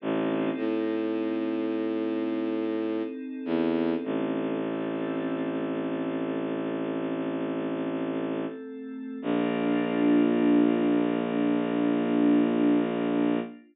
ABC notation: X:1
M:4/4
L:1/8
Q:1/4=52
K:Bb
V:1 name="Violin" clef=bass
A,,, A,,5 =E,, A,,,- | A,,,8 | B,,,8 |]
V:2 name="Pad 5 (bowed)"
[CEA]8 | [A,CA]8 | [B,DF]8 |]